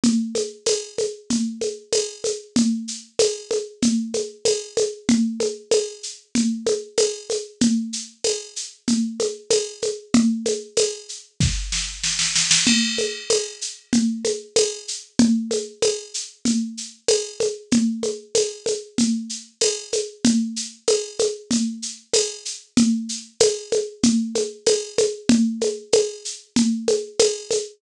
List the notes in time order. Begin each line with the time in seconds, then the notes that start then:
0.04 low conga, shaker
0.35 high conga, shaker
0.66 tambourine, high conga, shaker
0.98 high conga, shaker
1.30 low conga, shaker
1.61 high conga, shaker
1.93 tambourine, high conga, shaker
2.24 high conga, shaker
2.56 low conga, shaker
2.88 shaker
3.19 tambourine, high conga, shaker
3.51 high conga, shaker
3.82 low conga, shaker
4.14 high conga, shaker
4.45 tambourine, high conga, shaker
4.77 high conga, shaker
5.09 low conga, shaker
5.40 high conga, shaker
5.71 tambourine, high conga, shaker
6.03 shaker
6.35 low conga, shaker
6.66 high conga, shaker
6.98 tambourine, high conga, shaker
7.30 high conga, shaker
7.61 low conga, shaker
7.93 shaker
8.24 tambourine, high conga, shaker
8.56 shaker
8.88 low conga, shaker
9.20 high conga, shaker
9.50 tambourine, high conga, shaker
9.82 high conga, shaker
10.14 low conga, shaker
10.46 high conga, shaker
10.77 tambourine, high conga, shaker
11.09 shaker
11.41 kick, snare
11.72 snare
12.04 snare
12.19 snare
12.36 snare
12.51 snare
12.67 crash, low conga, shaker
12.98 high conga, shaker
13.30 tambourine, high conga, shaker
13.61 shaker
13.93 low conga, shaker
14.25 high conga, shaker
14.56 tambourine, high conga, shaker
14.88 shaker
15.19 low conga, shaker
15.51 high conga, shaker
15.82 tambourine, high conga, shaker
16.14 shaker
16.45 low conga, shaker
16.78 shaker
17.08 tambourine, high conga, shaker
17.40 high conga, shaker
17.71 low conga, shaker
18.03 high conga, shaker
18.35 tambourine, high conga, shaker
18.66 high conga, shaker
18.98 low conga, shaker
19.29 shaker
19.61 tambourine, high conga, shaker
19.93 high conga, shaker
20.25 low conga, shaker
20.56 shaker
20.88 tambourine, high conga, shaker
21.19 high conga, shaker
21.51 low conga, shaker
21.82 shaker
22.14 tambourine, high conga, shaker
22.45 shaker
22.77 low conga, shaker
23.09 shaker
23.40 tambourine, high conga, shaker
23.72 high conga, shaker
24.03 low conga, shaker
24.35 high conga, shaker
24.67 tambourine, high conga, shaker
24.98 high conga, shaker
25.29 low conga, shaker
25.61 high conga, shaker
25.93 tambourine, high conga, shaker
26.25 shaker
26.56 low conga, shaker
26.88 high conga, shaker
27.19 tambourine, high conga, shaker
27.51 high conga, shaker